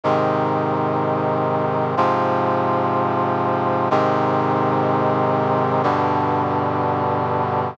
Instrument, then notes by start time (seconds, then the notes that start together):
brass section
0.04 G#2 C3 D#3
1.97 G#2 C3 F3
3.91 G#2 C3 D#3
5.83 G2 B2 D3